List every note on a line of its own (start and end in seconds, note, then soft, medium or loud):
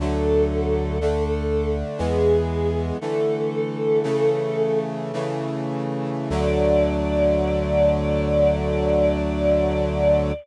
0.00 1.83 D2 medium
0.00 0.99 D3 loud
0.00 0.99 F#3 medium
0.00 0.99 A3 medium
0.00 1.76 A4 medium
1.01 2.00 D3 medium
1.01 2.00 A3 medium
1.01 2.00 D4 medium
1.98 2.92 E2 loud
1.98 2.97 E3 medium
1.98 2.97 G#3 loud
1.98 2.97 B3 medium
1.98 2.86 G#4 medium
2.99 4.03 D3 medium
2.99 4.03 E3 medium
2.99 4.03 A3 medium
2.99 4.79 A4 medium
4.03 5.12 C#3 loud
4.03 5.12 E3 medium
4.03 5.12 A3 loud
5.13 6.30 C#3 loud
5.13 6.30 E3 medium
5.13 6.30 A3 medium
6.30 10.33 D2 medium
6.30 10.32 D3 loud
6.30 10.32 F#3 loud
6.30 10.32 A3 medium
6.30 10.33 D5 loud